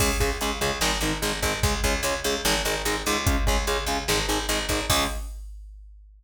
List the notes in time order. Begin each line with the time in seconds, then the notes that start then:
0.00 C#2 C#3 G#3, kick, crash
0.20 C#2 C#3 G#3, kick, closed hi-hat
0.41 C#2 C#3 G#3, closed hi-hat
0.61 C#2 C#3 G#3, closed hi-hat
0.81 G#1 D#3 G#3, snare
1.01 G#1 D#3 G#3, closed hi-hat
1.22 G#1 D#3 G#3, closed hi-hat
1.42 G#1 D#3 G#3, kick, closed hi-hat
1.63 C#2 C#3 G#3, kick, closed hi-hat
1.84 C#2 C#3 G#3, kick, closed hi-hat
2.03 C#2 C#3 G#3, closed hi-hat
2.24 C#2 C#3 G#3, closed hi-hat
2.45 G#1 D#3 G#3, snare
2.65 G#1 D#3 G#3, closed hi-hat
2.85 G#1 D#3 G#3, closed hi-hat
3.06 C#2 D#3 G#3, closed hi-hat
3.27 C#3 G#3, kick, closed hi-hat
3.47 C#2 C#3 G#3, kick, closed hi-hat
3.67 C#2 C#3 G#3, closed hi-hat
3.86 C#2 C#3 G#3, closed hi-hat
4.08 G#1 D#3 G#3, snare
4.29 G#1 D#3 G#3, closed hi-hat
4.49 G#1 D#3 G#3, closed hi-hat
4.69 G#1 D#3 G#3, kick, closed hi-hat
4.90 C#2 C#3 G#3, kick, crash